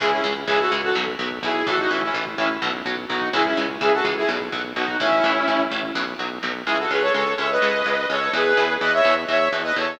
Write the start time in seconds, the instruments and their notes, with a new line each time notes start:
0.00 synth bass 1 C#2, overdriven guitar C#3 E3 G#3, lead 2 (sawtooth) E4 G#4, kick, crash
0.12 lead 2 (sawtooth) C#4 E4, kick
0.24 synth bass 1 C#2, overdriven guitar C#3 E3 G#3, kick, closed hi-hat
0.36 kick
0.47 synth bass 1 C#2, overdriven guitar C#3 E3 G#3, lead 2 (sawtooth) E4 G#4, kick, closed hi-hat
0.60 lead 2 (sawtooth) F#4 A4, kick
0.71 synth bass 1 C#2, overdriven guitar C#3 E3 G#3, kick, closed hi-hat
0.83 lead 2 (sawtooth) F#4 A4, kick
0.95 synth bass 1 B1, overdriven guitar B2 F#3, kick, snare
1.07 kick
1.19 synth bass 1 B1, overdriven guitar B2 F#3, kick, closed hi-hat
1.31 kick
1.43 synth bass 1 B1, overdriven guitar B2 F#3, lead 2 (sawtooth) E4 G#4, kick, closed hi-hat
1.55 kick
1.67 synth bass 1 A1, overdriven guitar A2 E3, lead 2 (sawtooth) F#4 A4, kick, closed hi-hat
1.79 lead 2 (sawtooth) D#4 F#4, kick
1.90 synth bass 1 A1, overdriven guitar A2 E3, lead 2 (sawtooth) C#4 E4, kick, closed hi-hat
2.02 lead 2 (sawtooth) C#4 E4, kick
2.14 synth bass 1 A1, overdriven guitar A2 E3, kick, closed hi-hat
2.26 kick
2.38 synth bass 1 A1, overdriven guitar A2 E3, lead 2 (sawtooth) C#4 E4, kick, closed hi-hat
2.50 kick
2.62 synth bass 1 B1, overdriven guitar B2 F#3, kick, snare
2.74 kick
2.85 synth bass 1 B1, overdriven guitar B2 F#3, kick, closed hi-hat
2.98 kick
3.08 synth bass 1 B1, overdriven guitar B2 F#3, lead 2 (sawtooth) D#4 F#4, kick, closed hi-hat
3.21 kick
3.33 synth bass 1 C#2, overdriven guitar C#3 E3 G#3, lead 2 (sawtooth) E4 G#4, kick, closed hi-hat
3.45 lead 2 (sawtooth) C#4 E4, kick
3.57 synth bass 1 C#2, overdriven guitar C#3 E3 G#3, kick, closed hi-hat
3.69 kick
3.81 synth bass 1 C#2, overdriven guitar C#3 E3 G#3, lead 2 (sawtooth) E4 G#4, kick, closed hi-hat
3.93 lead 2 (sawtooth) F#4 A4, kick
4.04 synth bass 1 C#2, overdriven guitar C#3 E3 G#3, kick, closed hi-hat
4.17 lead 2 (sawtooth) E4 G#4, kick
4.29 synth bass 1 B1, overdriven guitar B2 F#3, kick, snare
4.40 kick
4.52 synth bass 1 B1, overdriven guitar B2 F#3, kick, closed hi-hat
4.64 kick
4.76 synth bass 1 B1, overdriven guitar B2 F#3, lead 2 (sawtooth) D#4 F#4, kick, closed hi-hat
4.88 kick
4.99 synth bass 1 A1, overdriven guitar A2 E3, lead 2 (sawtooth) C#4 E4, kick, closed hi-hat
5.12 kick
5.24 synth bass 1 A1, overdriven guitar A2 E3, kick, closed hi-hat
5.36 kick
5.48 synth bass 1 A1, overdriven guitar A2 E3, kick, closed hi-hat
5.60 kick
5.71 synth bass 1 A1, overdriven guitar A2 E3, kick, closed hi-hat
5.83 kick
5.95 synth bass 1 B1, overdriven guitar B2 F#3, kick, snare
6.19 synth bass 1 B1, overdriven guitar B2 F#3
6.43 synth bass 1 B1, overdriven guitar B2 F#3, snare
6.66 synth bass 1 C#2, overdriven guitar C#3 G#3, lead 2 (sawtooth) E4 G#4
6.79 lead 2 (sawtooth) F#4 A4
6.91 synth bass 1 C#2, overdriven guitar C#3 G#3, lead 2 (sawtooth) G#4 B4
7.01 lead 2 (sawtooth) A4 C#5
7.14 synth bass 1 C#2, overdriven guitar C#3 G#3, lead 2 (sawtooth) A4 C#5
7.38 synth bass 1 C#2, overdriven guitar C#3 G#3, lead 2 (sawtooth) C#5 E5
7.50 lead 2 (sawtooth) B4 D#5
7.62 synth bass 1 C#2, overdriven guitar C#3 G#3
7.85 synth bass 1 C#2, overdriven guitar C#3 G#3
8.09 synth bass 1 C#2, overdriven guitar C#3 G#3, lead 2 (sawtooth) A4 C#5
8.33 synth bass 1 E2, overdriven guitar B2 E3, lead 2 (sawtooth) G#4 B4
8.57 synth bass 1 E2, overdriven guitar B2 E3
8.81 synth bass 1 E2, overdriven guitar B2 E3, lead 2 (sawtooth) B4 D#5
8.93 lead 2 (sawtooth) C#5 E5
9.05 synth bass 1 E2, overdriven guitar B2 E3
9.28 synth bass 1 E2, overdriven guitar B2 E3, lead 2 (sawtooth) C#5 E5
9.52 synth bass 1 E2, overdriven guitar B2 E3
9.64 lead 2 (sawtooth) B4 D#5
9.76 synth bass 1 E2, overdriven guitar B2 E3, lead 2 (sawtooth) A4 C#5